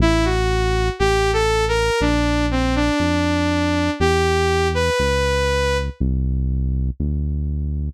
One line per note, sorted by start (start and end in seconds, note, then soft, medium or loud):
0.00 0.90 A1 loud
0.00 0.25 E4 loud
0.25 0.89 F#4 medium
0.99 1.90 A1 loud
0.99 1.31 G4 loud
1.33 1.65 A4 loud
1.68 2.00 A#4 loud
2.01 2.91 A#1 loud
2.01 2.46 D4 loud
2.51 2.75 C4 medium
2.75 3.90 D4 loud
3.00 3.90 F2 medium
4.00 4.90 E2 loud
4.00 4.68 G4 loud
4.74 5.77 B4 loud
5.00 5.90 C#2 medium
6.00 6.90 C2 loud
7.00 7.90 D2 medium